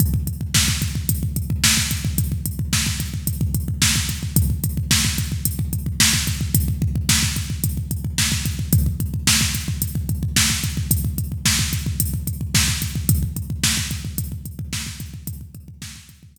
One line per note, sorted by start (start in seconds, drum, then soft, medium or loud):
0.00 kick loud
0.00 closed hi-hat medium
0.14 kick medium
0.27 kick medium
0.27 closed hi-hat medium
0.41 kick medium
0.54 kick medium
0.54 snare loud
0.68 kick medium
0.82 kick medium
0.82 closed hi-hat medium
0.95 kick medium
1.09 kick medium
1.09 closed hi-hat loud
1.23 kick medium
1.36 kick medium
1.36 closed hi-hat medium
1.50 kick medium
1.64 kick medium
1.64 snare loud
1.77 kick medium
1.91 kick medium
1.91 closed hi-hat medium
2.05 kick medium
2.18 kick medium
2.18 closed hi-hat medium
2.32 kick medium
2.46 kick medium
2.46 closed hi-hat medium
2.59 kick medium
2.73 kick medium
2.73 snare medium
2.86 kick medium
3.00 kick medium
3.00 closed hi-hat medium
3.14 kick medium
3.27 kick medium
3.27 closed hi-hat medium
3.41 kick medium
3.54 kick medium
3.54 closed hi-hat medium
3.68 kick medium
3.82 kick medium
3.82 snare loud
3.96 kick medium
4.09 kick medium
4.09 closed hi-hat medium
4.23 kick medium
4.36 kick loud
4.36 closed hi-hat loud
4.50 kick medium
4.64 kick medium
4.64 closed hi-hat medium
4.77 kick medium
4.91 kick medium
4.91 snare loud
5.05 kick medium
5.18 kick medium
5.18 closed hi-hat medium
5.32 kick medium
5.45 kick medium
5.45 closed hi-hat loud
5.59 kick medium
5.73 kick medium
5.73 closed hi-hat medium
5.86 kick medium
6.00 kick medium
6.00 snare loud
6.14 kick medium
6.27 kick medium
6.27 closed hi-hat medium
6.41 kick medium
6.54 kick loud
6.54 closed hi-hat loud
6.68 kick medium
6.82 kick medium
6.95 kick medium
7.09 kick medium
7.09 snare loud
7.09 closed hi-hat medium
7.23 kick medium
7.36 kick medium
7.36 closed hi-hat medium
7.50 kick medium
7.64 kick medium
7.64 closed hi-hat medium
7.77 kick medium
7.91 kick medium
7.91 closed hi-hat medium
8.05 kick medium
8.18 kick medium
8.18 snare medium
8.32 kick medium
8.45 kick medium
8.45 closed hi-hat medium
8.59 kick medium
8.73 kick loud
8.73 closed hi-hat medium
8.86 kick medium
9.00 kick medium
9.00 closed hi-hat medium
9.14 kick medium
9.27 kick medium
9.27 snare loud
9.41 kick medium
9.55 kick medium
9.55 closed hi-hat medium
9.68 kick medium
9.82 kick medium
9.82 closed hi-hat medium
9.95 kick medium
10.09 kick medium
10.09 closed hi-hat medium
10.23 kick medium
10.36 kick medium
10.36 snare loud
10.50 kick medium
10.64 kick medium
10.64 closed hi-hat medium
10.77 kick medium
10.91 kick medium
10.91 closed hi-hat loud
11.05 kick medium
11.18 kick medium
11.18 closed hi-hat medium
11.32 kick medium
11.45 kick medium
11.45 snare medium
11.59 kick medium
11.73 kick medium
11.73 closed hi-hat medium
11.86 kick medium
12.00 kick medium
12.00 closed hi-hat loud
12.14 kick medium
12.27 kick medium
12.27 closed hi-hat medium
12.41 kick medium
12.54 kick medium
12.54 snare medium
12.68 kick medium
12.82 kick medium
12.82 closed hi-hat medium
12.95 kick medium
13.09 kick loud
13.09 closed hi-hat loud
13.23 kick medium
13.36 kick medium
13.36 closed hi-hat medium
13.50 kick medium
13.64 kick medium
13.64 snare loud
13.77 kick medium
13.91 kick medium
13.91 closed hi-hat medium
14.05 kick medium
14.18 kick medium
14.18 closed hi-hat medium
14.32 kick medium
14.45 kick medium
14.45 closed hi-hat medium
14.59 kick medium
14.73 kick medium
14.73 snare medium
14.86 kick medium
15.00 kick medium
15.00 closed hi-hat medium
15.14 kick medium
15.27 kick loud
15.27 closed hi-hat loud
15.41 kick medium
15.55 kick medium
15.55 closed hi-hat medium
15.68 kick medium
15.82 kick medium
15.82 snare medium
15.96 kick medium
16.09 kick medium
16.09 closed hi-hat medium
16.23 kick medium
16.36 kick medium
16.36 closed hi-hat loud